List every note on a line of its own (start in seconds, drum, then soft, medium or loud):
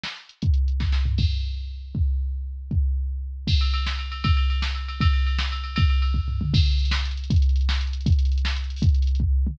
0.04 snare loud
0.16 closed hi-hat medium
0.29 closed hi-hat medium
0.42 kick loud
0.42 closed hi-hat medium
0.54 closed hi-hat medium
0.68 closed hi-hat medium
0.80 kick medium
0.80 snare medium
0.92 snare medium
1.05 floor tom loud
1.18 kick loud
1.18 crash medium
1.95 kick loud
2.71 kick loud
3.47 kick loud
3.47 crash loud
3.61 ride medium
3.74 ride medium
3.86 snare loud
3.99 ride medium
4.12 ride medium
4.24 kick loud
4.24 ride loud
4.37 ride medium
4.50 ride medium
4.62 snare loud
4.75 ride medium
4.88 ride medium
5.01 kick loud
5.01 ride loud
5.13 ride medium
5.27 ride medium
5.39 snare loud
5.52 ride medium
5.64 ride medium
5.76 kick loud
5.76 ride loud
5.90 ride medium
6.02 ride medium
6.14 kick medium
6.28 floor tom medium
6.41 mid tom loud
6.54 kick loud
6.54 crash loud
6.60 closed hi-hat medium
6.66 closed hi-hat medium
6.72 closed hi-hat medium
6.79 closed hi-hat medium
6.85 closed hi-hat medium
6.91 snare loud
6.99 closed hi-hat medium
7.05 closed hi-hat medium
7.11 closed hi-hat medium
7.17 closed hi-hat medium
7.24 closed hi-hat medium
7.30 kick loud
7.30 closed hi-hat loud
7.36 closed hi-hat medium
7.42 closed hi-hat medium
7.49 closed hi-hat medium
7.56 closed hi-hat medium
7.61 closed hi-hat medium
7.69 snare loud
7.75 closed hi-hat medium
7.81 closed hi-hat medium
7.87 closed hi-hat medium
7.93 closed hi-hat medium
8.01 closed hi-hat medium
8.06 kick loud
8.06 closed hi-hat loud
8.12 closed hi-hat medium
8.19 closed hi-hat medium
8.25 closed hi-hat medium
8.32 closed hi-hat medium
8.38 closed hi-hat medium
8.45 snare loud
8.51 closed hi-hat medium
8.56 closed hi-hat medium
8.64 closed hi-hat medium
8.70 closed hi-hat medium
8.76 open hi-hat medium
8.82 kick loud
8.82 closed hi-hat loud
8.89 closed hi-hat medium
8.94 closed hi-hat medium
9.02 closed hi-hat medium
9.07 closed hi-hat medium
9.15 closed hi-hat medium
9.20 kick medium
9.47 mid tom loud